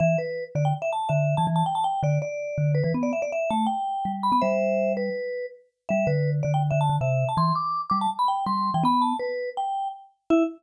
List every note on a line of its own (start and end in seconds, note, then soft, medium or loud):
0.00 0.16 E3 medium
0.00 0.17 E5 loud
0.18 0.44 B4 medium
0.55 0.73 D3 medium
0.55 0.64 D5 medium
0.65 0.74 G5 medium
0.82 0.91 E5 medium
0.93 1.10 A5 medium
1.09 1.35 D3 medium
1.09 1.35 E5 medium
1.37 1.47 E3 medium
1.37 1.46 A5 medium
1.47 1.63 E3 medium
1.56 1.64 A5 medium
1.66 1.75 G5 medium
1.75 1.84 A5 medium
1.84 2.01 G5 medium
2.03 2.18 D3 medium
2.03 2.19 D5 medium
2.22 2.72 D5 medium
2.58 2.82 D3 medium
2.75 2.83 B4 medium
2.84 2.93 E3 medium
2.84 2.92 B4 medium
2.94 3.12 B3 medium
3.03 3.12 D5 medium
3.13 3.21 E5 medium
3.22 3.31 D5 medium
3.32 3.50 E5 medium
3.50 3.67 A3 medium
3.50 3.66 A5 medium
3.66 4.12 G5 medium
4.05 4.31 G3 medium
4.23 4.32 B5 medium
4.32 4.41 B3 medium
4.32 4.41 B5 medium
4.41 5.10 G3 medium
4.41 4.93 C5 medium
4.41 4.93 E5 loud
4.97 5.46 B4 medium
5.89 6.06 G3 medium
5.89 6.07 E5 loud
6.07 6.41 D3 medium
6.07 6.30 B4 medium
6.43 6.70 D3 medium
6.43 6.52 D5 medium
6.54 6.63 G5 medium
6.71 6.89 D3 medium
6.71 6.79 E5 medium
6.81 6.96 A5 medium
6.89 6.98 D3 medium
7.01 7.24 C3 medium
7.01 7.28 E5 medium
7.29 7.37 A5 medium
7.37 7.52 E3 medium
7.37 7.53 C6 medium
7.55 7.81 D6 medium
7.90 8.07 G3 medium
7.90 7.98 D6 medium
8.01 8.10 A5 medium
8.19 8.28 B5 medium
8.28 8.45 G5 medium
8.46 8.71 G3 medium
8.46 8.70 C6 medium
8.74 8.83 E3 medium
8.74 8.83 G5 medium
8.84 9.13 B3 medium
8.84 9.03 B5 loud
9.02 9.17 A5 medium
9.19 9.50 B4 medium
9.57 9.88 G5 medium
10.30 10.43 E4 loud
10.30 10.43 E5 loud